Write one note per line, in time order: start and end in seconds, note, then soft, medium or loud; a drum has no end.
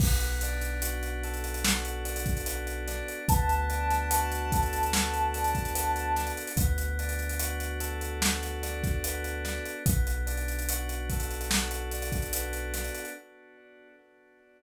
0.00 3.02 B1 medium
0.00 2.46 B3 loud
0.00 kick loud
0.00 crash loud
0.20 closed hi-hat medium
0.41 2.04 D4 medium
0.41 closed hi-hat loud
0.61 closed hi-hat medium
0.82 1.64 F#4 medium
0.82 closed hi-hat loud
1.03 closed hi-hat medium
1.23 3.19 A4 medium
1.23 closed hi-hat medium
1.34 closed hi-hat medium
1.44 closed hi-hat medium
1.54 closed hi-hat medium
1.64 3.20 F#4 medium
1.64 snare loud
1.85 closed hi-hat medium
2.05 2.87 D4 medium
2.05 closed hi-hat medium
2.16 closed hi-hat loud
2.26 kick loud
2.26 closed hi-hat medium
2.37 closed hi-hat medium
2.46 3.25 B3 medium
2.46 closed hi-hat loud
2.67 closed hi-hat medium
2.88 3.27 D4 loud
2.88 snare medium
2.88 closed hi-hat medium
3.08 closed hi-hat medium
3.28 6.31 D2 medium
3.28 5.74 B3 loud
3.28 6.32 A5 medium
3.28 kick loud
3.28 closed hi-hat loud
3.49 closed hi-hat medium
3.70 5.34 D4 medium
3.70 closed hi-hat medium
3.91 snare medium
3.91 closed hi-hat medium
4.10 4.93 F#4 medium
4.10 closed hi-hat loud
4.32 closed hi-hat medium
4.52 6.47 A4 medium
4.52 kick loud
4.52 closed hi-hat loud
4.63 closed hi-hat medium
4.73 closed hi-hat medium
4.83 closed hi-hat medium
4.93 6.50 F#4 medium
4.93 snare loud
5.14 closed hi-hat medium
5.34 6.17 D4 medium
5.34 closed hi-hat medium
5.44 closed hi-hat medium
5.55 kick medium
5.55 closed hi-hat medium
5.65 closed hi-hat medium
5.74 6.53 B3 medium
5.74 closed hi-hat loud
5.96 closed hi-hat medium
6.16 6.57 D4 medium
6.16 snare medium
6.16 closed hi-hat medium
6.27 closed hi-hat medium
6.37 closed hi-hat medium
6.47 closed hi-hat medium
6.57 9.59 D2 medium
6.57 9.05 B3 loud
6.57 kick loud
6.57 closed hi-hat loud
6.78 closed hi-hat medium
6.99 8.62 D4 medium
6.99 closed hi-hat medium
7.09 closed hi-hat medium
7.19 closed hi-hat medium
7.29 closed hi-hat medium
7.39 8.21 F#4 medium
7.39 closed hi-hat loud
7.60 closed hi-hat medium
7.80 9.76 A4 medium
7.80 closed hi-hat loud
8.01 closed hi-hat medium
8.21 9.77 F#4 medium
8.21 snare loud
8.42 snare soft
8.42 closed hi-hat medium
8.63 9.44 D4 medium
8.63 snare soft
8.63 closed hi-hat medium
8.84 kick loud
8.84 snare soft
8.84 closed hi-hat medium
9.04 9.84 B3 loud
9.04 closed hi-hat loud
9.24 closed hi-hat medium
9.44 9.83 D4 medium
9.44 snare medium
9.44 closed hi-hat medium
9.66 closed hi-hat medium
9.86 12.90 B1 medium
9.86 12.34 B3 medium
9.86 kick loud
9.86 closed hi-hat loud
10.07 closed hi-hat medium
10.26 11.93 D4 medium
10.26 closed hi-hat medium
10.38 closed hi-hat medium
10.48 closed hi-hat medium
10.59 closed hi-hat medium
10.69 11.49 F#4 medium
10.69 closed hi-hat loud
10.89 closed hi-hat medium
11.10 13.07 A4 medium
11.10 kick medium
11.10 closed hi-hat medium
11.20 closed hi-hat medium
11.31 closed hi-hat medium
11.41 closed hi-hat medium
11.49 13.05 F#4 medium
11.49 snare loud
11.71 closed hi-hat medium
11.91 12.74 D4 medium
11.91 closed hi-hat medium
12.02 closed hi-hat medium
12.12 kick medium
12.12 closed hi-hat medium
12.22 closed hi-hat medium
12.33 13.12 B3 medium
12.33 closed hi-hat loud
12.53 closed hi-hat medium
12.74 13.14 D4 medium
12.74 snare medium
12.74 closed hi-hat loud
12.84 closed hi-hat medium
12.95 closed hi-hat medium
13.05 closed hi-hat medium